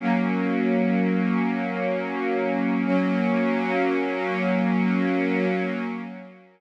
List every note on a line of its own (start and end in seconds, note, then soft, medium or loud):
0.00 2.83 F#3 medium
0.00 2.83 A#3 medium
0.00 2.83 C#4 medium
2.86 5.45 F#3 loud
2.86 5.45 A#3 medium
2.86 5.45 C#4 loud